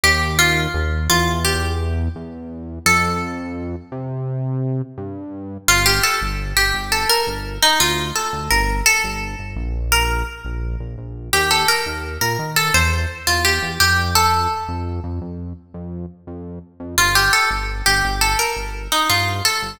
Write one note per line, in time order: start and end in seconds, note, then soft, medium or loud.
0.03 0.67 D#2 loud
0.03 0.35 G4 medium
0.39 1.04 F4 medium
0.74 1.08 D#2 medium
1.10 2.09 E2 loud
1.10 1.39 F4 medium
1.45 1.78 G4 medium
2.15 2.79 E2 medium
2.86 3.76 F2 loud
2.86 4.07 A4 loud
3.92 4.82 C3 medium
4.97 5.57 G2 medium
5.68 6.00 G1 medium
5.68 5.85 F4 loud
5.86 6.02 G4 loud
6.03 6.20 A4 medium
6.21 6.53 G1 medium
6.57 6.72 G1 medium
6.57 6.88 G4 medium
6.74 7.05 G1 medium
6.92 7.09 A4 medium
7.09 7.26 A#4 loud
7.27 7.59 G1 medium
7.62 7.79 D#4 loud
7.80 8.12 D2 medium
7.80 8.11 F4 medium
8.15 8.49 A4 medium
8.33 8.49 D2 medium
8.50 8.82 G1 medium
8.50 8.84 A#4 medium
8.86 9.49 A4 loud
9.04 9.35 G1 medium
9.39 9.55 G1 medium
9.56 10.23 A#1 medium
9.92 10.25 A#4 loud
10.45 10.76 A#1 medium
10.80 10.96 A#1 medium
10.98 11.30 A#1 medium
11.33 11.65 D#2 medium
11.33 11.50 G4 loud
11.51 11.67 A4 medium
11.68 11.85 A#4 medium
11.86 12.18 D#2 medium
12.21 12.37 A#2 medium
12.21 12.55 A#4 medium
12.39 12.70 D#3 medium
12.56 12.73 A4 medium
12.74 13.06 E2 medium
12.74 12.91 C5 medium
13.27 13.59 E2 medium
13.27 13.44 F4 medium
13.45 13.74 G4 medium
13.62 13.78 E2 medium
13.80 14.47 F2 medium
13.80 14.11 G4 loud
14.15 15.88 A4 loud
14.68 15.00 F2 medium
15.04 15.20 F2 medium
15.21 15.53 F2 medium
15.74 16.06 F2 medium
16.27 16.59 F2 medium
16.80 16.96 F2 medium
16.98 17.29 G1 medium
16.98 17.15 F4 loud
17.15 17.32 G4 medium
17.33 17.50 A4 medium
17.51 17.82 G1 medium
17.86 18.02 G1 medium
17.86 18.15 G4 medium
18.04 18.35 G1 medium
18.21 18.38 A4 medium
18.39 18.56 A#4 medium
18.56 18.88 G1 medium
18.92 19.09 D#4 medium
19.09 19.41 G2 medium
19.09 19.43 F4 medium
19.45 19.75 A4 medium
19.62 19.78 G1 medium